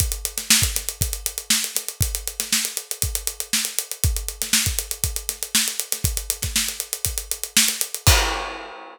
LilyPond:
\new DrumStaff \drummode { \time 4/4 \tempo 4 = 119 <hh bd>16 hh16 hh16 <hh sn>16 sn16 <hh bd>16 <hh sn>16 hh16 <hh bd>16 hh16 hh16 hh16 sn16 hh16 <hh sn>16 hh16 | <hh bd>16 hh16 hh16 <hh sn>16 sn16 hh16 hh16 hh16 <hh bd>16 hh16 hh16 hh16 sn16 hh16 hh16 hh16 | <hh bd>16 hh16 hh16 <hh sn>16 sn16 <hh bd>16 hh16 hh16 <hh bd>16 hh16 <hh sn>16 hh16 sn16 hh16 hh16 <hh sn>16 | <hh bd>16 hh16 hh16 <hh bd sn>16 sn16 <hh sn>16 hh16 hh16 <hh bd>16 hh16 hh16 hh16 sn16 <hh sn>16 hh16 hh16 |
<cymc bd>4 r4 r4 r4 | }